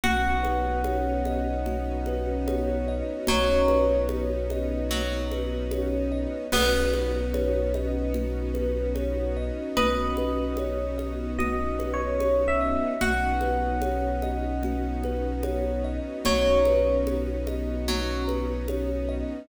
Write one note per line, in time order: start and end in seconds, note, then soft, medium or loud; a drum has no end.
0.04 3.02 B1 medium
0.04 6.46 B3 medium
0.04 6.46 C#4 medium
0.04 6.46 D#4 medium
0.04 2.65 F#4 medium
0.04 6.46 F#4 medium
0.04 1.66 F#4 medium
0.04 2.91 F#5 medium
0.04 low conga loud
0.43 2.07 B4 medium
0.43 high conga medium
0.84 2.47 C#5 medium
0.84 high conga medium
1.25 2.88 D#5 medium
1.25 high conga medium
1.66 3.27 F#4 medium
1.66 low conga medium
2.06 3.69 B4 medium
2.06 high conga medium
2.48 4.09 C#5 medium
2.48 high conga medium
2.88 4.51 D#5 medium
3.27 6.26 B1 medium
3.27 3.61 F#3 medium
3.27 4.90 F#4 medium
3.27 3.97 C#5 medium
3.27 low conga loud
3.68 5.31 B4 medium
3.68 high conga medium
4.09 5.71 C#5 medium
4.09 high conga medium
4.50 6.11 D#5 medium
4.50 high conga medium
4.90 5.27 F#3 medium
4.90 6.44 F#4 medium
4.90 low conga medium
5.31 6.47 B4 medium
5.31 high conga medium
5.71 6.49 C#5 medium
5.71 high conga loud
6.12 6.50 D#5 medium
6.52 9.51 B1 medium
6.52 12.94 B3 medium
6.52 9.63 B3 medium
6.52 12.94 C#4 medium
6.52 12.94 D#4 medium
6.52 12.94 F#4 medium
6.52 6.93 F#4 medium
6.52 9.56 B4 medium
6.52 crash loud
6.52 low conga loud
6.93 7.33 B4 medium
6.93 high conga medium
7.34 7.75 C#5 medium
7.34 high conga medium
7.74 8.15 D#5 medium
7.74 high conga medium
8.14 8.55 F#4 medium
8.14 low conga medium
8.54 8.94 B4 medium
8.54 high conga medium
8.95 9.35 C#5 medium
8.95 high conga medium
9.37 9.77 D#5 medium
9.77 12.75 B1 medium
9.77 10.17 F#4 medium
9.77 12.85 B4 medium
9.77 11.32 D#5 medium
9.77 low conga loud
10.17 10.59 B4 medium
10.17 high conga medium
10.57 11.00 C#5 medium
10.57 high conga medium
10.98 11.39 D#5 medium
10.98 high conga medium
11.39 11.79 F#4 medium
11.39 11.90 D#5 medium
11.39 low conga medium
11.79 12.19 B4 medium
11.79 high conga medium
11.94 12.44 C#5 medium
12.20 12.61 C#5 medium
12.20 high conga medium
12.48 13.00 E5 medium
12.61 12.99 D#5 medium
13.01 15.99 B1 medium
13.01 19.45 B3 medium
13.01 19.45 C#4 medium
13.01 19.45 D#4 medium
13.01 13.42 F#4 medium
13.01 15.63 F#4 medium
13.01 19.45 F#4 medium
13.01 15.88 F#5 medium
13.01 low conga loud
13.41 13.82 B4 medium
13.41 high conga medium
13.82 14.22 C#5 medium
13.82 high conga medium
14.22 14.64 D#5 medium
14.22 high conga medium
14.63 15.05 F#4 medium
14.63 low conga medium
15.04 15.45 B4 medium
15.04 high conga medium
15.43 15.84 C#5 medium
15.43 high conga medium
15.84 16.25 D#5 medium
16.25 19.24 B1 medium
16.25 16.58 F#3 medium
16.25 16.66 F#4 medium
16.25 16.95 C#5 medium
16.25 low conga loud
16.65 17.08 B4 medium
16.65 high conga medium
17.07 17.48 C#5 medium
17.07 high conga medium
17.47 17.88 D#5 medium
17.47 high conga medium
17.88 18.24 F#3 medium
17.88 18.29 F#4 medium
17.88 low conga medium
18.28 18.68 B4 medium
18.28 high conga medium
18.68 19.10 C#5 medium
18.68 high conga loud
19.09 19.47 D#5 medium